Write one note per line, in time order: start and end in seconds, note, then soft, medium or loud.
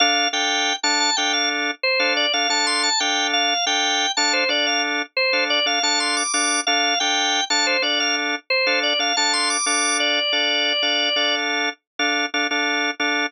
0.00 0.27 D4 loud
0.00 0.27 A4 loud
0.00 0.29 F5 medium
0.33 0.73 D4 medium
0.33 0.73 A4 loud
0.33 0.73 F5 loud
0.33 0.76 G5 medium
0.83 1.10 D4 loud
0.83 1.10 A4 medium
0.83 1.10 F5 medium
0.83 0.99 A5 medium
1.00 1.16 A5 medium
1.17 1.71 D4 loud
1.17 1.71 A4 loud
1.17 1.71 F5 medium
1.17 1.32 G5 medium
1.33 1.49 F5 medium
1.83 2.13 C5 medium
2.00 2.26 D4 loud
2.00 2.26 A4 loud
2.00 2.26 F5 loud
2.17 2.33 D5 medium
2.33 2.47 D4 medium
2.33 2.47 A4 loud
2.33 2.49 F5 medium
2.49 2.89 D4 medium
2.49 2.89 A4 loud
2.49 2.89 F5 medium
2.49 2.66 A5 medium
2.67 2.83 C6 medium
2.83 2.99 A5 medium
3.00 3.54 D4 loud
3.00 3.54 A4 loud
3.00 3.54 F5 loud
3.00 3.27 G5 medium
3.33 3.65 F5 medium
3.66 4.06 D4 medium
3.66 4.06 A4 loud
3.66 4.06 F5 loud
3.66 4.12 G5 medium
4.17 4.44 D4 loud
4.17 4.44 A4 loud
4.17 4.44 F5 loud
4.17 4.33 A5 medium
4.33 4.49 C5 medium
4.49 5.02 D4 loud
4.49 5.02 A4 loud
4.49 4.66 D5 medium
4.49 5.02 F5 medium
4.67 4.83 F5 medium
5.17 5.44 C5 medium
5.33 5.60 D4 medium
5.33 5.60 A4 medium
5.33 5.60 F5 medium
5.50 5.66 D5 medium
5.66 5.79 D4 loud
5.66 5.79 A4 loud
5.66 5.83 F5 medium
5.83 6.23 D4 loud
5.83 6.23 A4 loud
5.83 6.23 F5 loud
5.83 5.99 A5 medium
6.00 6.16 C6 medium
6.17 6.33 D6 medium
6.33 6.60 D4 loud
6.33 6.60 A4 medium
6.33 6.60 F5 loud
6.33 6.61 D6 medium
6.67 6.94 D4 loud
6.67 6.94 A4 loud
6.67 6.99 F5 medium
7.00 7.41 D4 medium
7.00 7.41 A4 loud
7.00 7.41 F5 loud
7.00 7.44 G5 medium
7.50 7.77 D4 loud
7.50 7.77 A4 loud
7.50 7.77 F5 loud
7.50 7.66 A5 medium
7.67 7.83 C5 medium
7.82 8.35 D4 loud
7.82 8.35 A4 loud
7.82 7.99 D5 medium
7.82 8.35 F5 medium
8.00 8.16 F5 medium
8.50 8.79 C5 medium
8.67 8.93 D4 loud
8.67 8.93 A4 loud
8.67 8.93 F5 loud
8.83 8.99 D5 medium
8.99 9.13 D4 medium
8.99 9.13 A4 medium
8.99 9.16 F5 medium
9.17 9.57 D4 medium
9.17 9.57 A4 medium
9.17 9.57 F5 loud
9.17 9.33 A5 medium
9.33 9.49 C6 medium
9.50 9.66 D6 medium
9.66 10.20 D4 loud
9.66 10.20 A4 loud
9.66 10.20 F5 loud
9.66 9.98 D6 medium
10.00 11.35 D5 medium
10.33 10.73 D4 medium
10.33 10.73 A4 loud
10.33 10.73 F5 medium
10.83 11.09 D4 medium
10.83 11.09 A4 medium
10.83 11.09 F5 loud
11.16 11.69 D4 medium
11.16 11.69 A4 loud
11.16 11.69 F5 loud
11.99 12.26 D4 loud
11.99 12.26 A4 medium
11.99 12.26 F5 loud
12.34 12.47 D4 loud
12.34 12.47 A4 loud
12.34 12.47 F5 loud
12.51 12.91 D4 loud
12.51 12.91 A4 loud
12.51 12.91 F5 loud
13.00 13.26 D4 loud
13.00 13.26 A4 loud
13.00 13.26 F5 medium